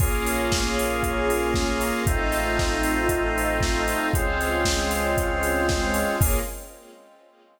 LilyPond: <<
  \new Staff \with { instrumentName = "Drawbar Organ" } { \time 4/4 \key bes \minor \tempo 4 = 116 <bes des' f' aes'>1 | <a c' ees' f'>1 | <aes c' des' f'>1 | <bes des' f' aes'>4 r2. | }
  \new Staff \with { instrumentName = "Lead 1 (square)" } { \time 4/4 \key bes \minor <aes' bes' des'' f''>1 | <a' c'' ees'' f''>1 | <aes' c'' des'' f''>1 | <aes' bes' des'' f''>4 r2. | }
  \new Staff \with { instrumentName = "Synth Bass 1" } { \clef bass \time 4/4 \key bes \minor bes,,1 | a,,1 | des,1 | bes,,4 r2. | }
  \new Staff \with { instrumentName = "String Ensemble 1" } { \time 4/4 \key bes \minor <bes des' f' aes'>1 | <a c' ees' f'>1 | <aes c' des' f'>1 | <bes des' f' aes'>4 r2. | }
  \new DrumStaff \with { instrumentName = "Drums" } \drummode { \time 4/4 <cymc bd>8 hho8 <bd sn>8 hho8 <hh bd>8 hho8 <bd sn>8 hho8 | <hh bd>8 hho8 <bd sn>8 hho8 <hh bd>8 hho8 <bd sn>8 hho8 | <hh bd>8 hho8 <bd sn>8 hho8 <hh bd>8 hho8 <bd sn>8 hho8 | <cymc bd>4 r4 r4 r4 | }
>>